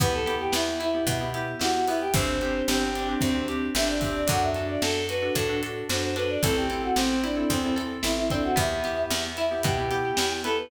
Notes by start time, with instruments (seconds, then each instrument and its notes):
0.00 electric bass (finger) E2, acoustic guitar (steel) B3, electric piano 2 B3 E4 G4, choir aahs B4, kick, closed hi-hat
0.13 choir aahs A4
0.26 electric piano 2 B3 E4 G4, acoustic guitar (steel) G4, closed hi-hat
0.40 choir aahs G4
0.52 electric bass (finger) E2, acoustic guitar (steel) B3, choir aahs E4, snare
0.80 acoustic guitar (steel) E4, choir aahs E4, closed hi-hat
0.94 electric piano 2 B3 E4 G4
1.07 electric bass (finger) B2, acoustic guitar (steel) B3, choir aahs E4, kick, closed hi-hat
1.20 electric piano 2 B3 E4 G4
1.34 electric piano 2 B3 E4 G4, acoustic guitar (steel) G4, closed hi-hat
1.59 electric bass (finger) E2, electric piano 2 B3 E4 G4, acoustic guitar (steel) E4, choir aahs F#4, snare
1.74 choir aahs F#4
1.87 electric piano 2 B3 E4 G4, acoustic guitar (steel) B3, choir aahs E4, open hi-hat
2.01 choir aahs G4
2.14 electric bass (finger) G1, electric piano 2 C4 D4 G4, acoustic guitar (steel) C4, choir aahs C5, kick, closed hi-hat
2.41 electric piano 2 C4 D4 G4, acoustic guitar (steel) G4, closed hi-hat
2.68 electric bass (finger) G1, acoustic guitar (steel) C4, choir aahs G4, snare
2.95 acoustic guitar (steel) D4, closed hi-hat
3.08 electric piano 2 C4 D4 G4
3.21 electric bass (finger) D2, acoustic guitar (steel) C4, choir aahs C5, kick, closed hi-hat
3.35 electric piano 2 C4 D4 G4
3.48 electric piano 2 C4 D4 G4, acoustic guitar (steel) G4, closed hi-hat
3.75 electric bass (finger) G1, electric piano 2 C4 D4 G4, acoustic guitar (steel) D4, choir aahs E5, snare
3.88 choir aahs D5
4.01 acoustic guitar (steel) C4, electric piano 2 C4 D4 G4, kick, open hi-hat
4.15 choir aahs D5
4.27 electric bass (finger) F#2, acoustic guitar (steel) D4, electric piano 2 D4 F#4 A4, choir aahs F#5, kick, closed hi-hat
4.42 choir aahs E5
4.54 electric piano 2 D4 F#4 A4, acoustic guitar (steel) A4, closed hi-hat
4.69 choir aahs D5
4.82 electric bass (finger) F#2, acoustic guitar (steel) D4, choir aahs A4, snare
5.09 acoustic guitar (steel) F#4, choir aahs B4, closed hi-hat
5.22 electric piano 2 D4 F#4 A4
5.35 electric bass (finger) A2, acoustic guitar (steel) D4, choir aahs A4, kick, closed hi-hat
5.49 electric piano 2 D4 F#4 A4
5.62 electric piano 2 D4 F#4 A4, acoustic guitar (steel) A4, closed hi-hat
5.89 electric bass (finger) F#2, electric piano 2 D4 F#4 A4, acoustic guitar (steel) F#4, choir aahs C5, snare
6.02 choir aahs C5
6.16 electric piano 2 D4 F#4 A4, acoustic guitar (steel) D4, choir aahs B4, closed hi-hat
6.29 choir aahs D5
6.43 electric bass (finger) A1, electric piano 2 C4 E4 A4, acoustic guitar (steel) C4, choir aahs A4, kick, closed hi-hat
6.56 choir aahs G4
6.70 electric piano 2 C4 E4 A4, acoustic guitar (steel) A4, closed hi-hat
6.83 choir aahs F#4
6.96 electric bass (finger) A1, choir aahs C4, acoustic guitar (steel) C4, snare
7.23 choir aahs D4, acoustic guitar (steel) E4, closed hi-hat
7.36 electric piano 2 C4 E4 A4
7.50 electric bass (finger) E2, choir aahs C4, acoustic guitar (steel) C4, kick, closed hi-hat
7.64 electric piano 2 C4 E4 A4
7.76 electric piano 2 C4 E4 A4, acoustic guitar (steel) A4, closed hi-hat
8.03 electric bass (finger) A1, electric piano 2 C4 E4 A4, acoustic guitar (steel) E4, choir aahs E4, snare
8.17 choir aahs E4
8.30 electric piano 2 C4 E4 A4, acoustic guitar (steel) C4, choir aahs D4, kick, closed hi-hat
8.44 choir aahs F#4
8.56 electric bass (finger) E2, acoustic guitar (steel) B3, electric piano 2 B3 E4 G4, choir aahs E5, kick, closed hi-hat
8.84 electric piano 2 B3 E4 G4, acoustic guitar (steel) G4, closed hi-hat
9.10 electric bass (finger) E2, acoustic guitar (steel) B3, choir aahs E5, snare
9.37 acoustic guitar (steel) E4, choir aahs E5, closed hi-hat
9.51 electric piano 2 B3 E4 G4
9.63 electric bass (finger) B2, acoustic guitar (steel) B3, choir aahs G4, kick, closed hi-hat
9.78 electric piano 2 B3 E4 G4
9.91 electric piano 2 B3 E4 G4, acoustic guitar (steel) G4, closed hi-hat
10.17 electric bass (finger) E2, electric piano 2 B3 E4 G4, acoustic guitar (steel) E4, snare
10.44 electric piano 2 B3 E4 G4, acoustic guitar (steel) B3, choir aahs A4, closed hi-hat
10.58 choir aahs B4